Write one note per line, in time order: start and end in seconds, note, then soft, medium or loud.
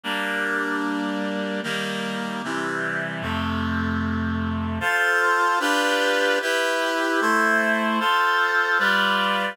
0.03 1.61 G3 medium
0.03 1.61 A#3 medium
0.03 1.61 D4 medium
1.63 2.42 D#3 medium
1.63 2.42 G3 medium
1.63 2.42 A#3 medium
2.44 3.21 C3 medium
2.44 3.22 E3 medium
2.44 3.22 G3 medium
3.22 4.79 F2 medium
3.22 4.79 C3 medium
3.22 4.79 A3 medium
4.80 5.59 F4 loud
4.80 5.59 A4 medium
4.80 5.59 C5 medium
5.60 6.39 D4 medium
5.60 6.39 F4 medium
5.60 6.39 G4 medium
5.60 6.39 B4 loud
6.42 7.20 E4 medium
6.42 7.20 G4 loud
6.42 7.20 B4 medium
7.21 7.99 A3 medium
7.21 7.99 E4 medium
7.21 7.99 C5 medium
8.00 8.78 F4 medium
8.00 8.78 A4 medium
8.00 8.78 C5 medium
8.79 9.57 G3 medium
8.79 9.57 F4 medium
8.79 9.57 B4 medium
8.79 9.57 D5 medium